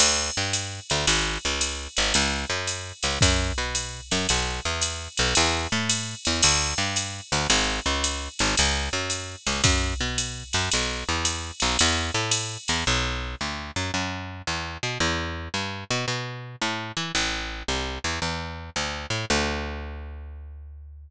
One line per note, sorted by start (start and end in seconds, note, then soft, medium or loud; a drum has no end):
0.00 0.30 D2 medium
0.00 crash loud
0.00 ride loud
0.37 0.80 G2 medium
0.53 hi-hat pedal medium
0.53 ride medium
0.90 1.06 D2 medium
0.90 ride medium
1.07 1.38 G#1 medium
1.07 ride loud
1.45 1.88 C#2 medium
1.61 hi-hat pedal medium
1.61 ride loud
1.97 2.13 G#1 medium
1.97 ride medium
2.14 2.45 C#2 medium
2.14 ride loud
2.50 2.92 F#2 medium
2.67 hi-hat pedal medium
2.67 ride medium
3.03 3.19 C#2 medium
3.03 ride medium
3.21 3.52 F#2 medium
3.21 kick medium
3.21 ride loud
3.58 4.01 B2 medium
3.75 hi-hat pedal medium
3.75 ride medium
4.11 4.27 F#2 medium
4.11 ride medium
4.29 4.60 B1 medium
4.29 ride loud
4.65 5.08 E2 medium
4.81 hi-hat pedal loud
4.81 ride loud
5.17 5.34 B1 medium
5.17 ride medium
5.35 5.67 E2 medium
5.35 ride loud
5.72 6.15 A2 medium
5.90 hi-hat pedal medium
5.90 ride loud
6.25 6.42 E2 medium
6.25 ride medium
6.43 6.74 D2 medium
6.43 crash loud
6.43 ride loud
6.78 7.21 G2 medium
6.96 hi-hat pedal medium
6.96 ride medium
7.32 7.47 D2 medium
7.32 ride medium
7.50 7.80 G#1 medium
7.50 ride loud
7.86 8.29 C#2 medium
8.04 hi-hat pedal medium
8.04 ride loud
8.39 8.55 G#1 medium
8.39 ride medium
8.57 8.89 C#2 medium
8.57 ride loud
8.93 9.36 F#2 medium
9.10 hi-hat pedal medium
9.10 ride medium
9.47 9.62 C#2 medium
9.47 ride medium
9.64 9.94 F#2 medium
9.64 kick medium
9.64 ride loud
10.01 10.43 B2 medium
10.18 hi-hat pedal medium
10.18 ride medium
10.53 10.69 F#2 medium
10.53 ride medium
10.71 11.04 B1 medium
10.71 ride loud
11.09 11.51 E2 medium
11.25 hi-hat pedal loud
11.25 ride loud
11.60 11.77 B1 medium
11.60 ride medium
11.79 12.11 E2 medium
11.79 ride loud
12.14 12.57 A2 medium
12.31 hi-hat pedal medium
12.31 ride loud
12.68 12.84 E2 medium
12.68 ride medium
12.87 13.35 B1 medium
13.41 13.71 D2 medium
13.76 13.91 F#2 medium
13.94 14.42 F#2 medium
14.47 14.78 E2 medium
14.83 14.98 B2 medium
15.00 15.49 E2 medium
15.54 15.84 G2 medium
15.91 16.06 B2 medium
16.08 16.56 B2 medium
16.61 16.92 A2 medium
16.97 17.12 E3 medium
17.15 17.63 A1 medium
17.68 17.99 C2 medium
18.04 18.19 E2 medium
18.22 18.70 E2 medium
18.76 19.06 D2 medium
19.10 19.25 A2 medium
19.30 21.10 D2 medium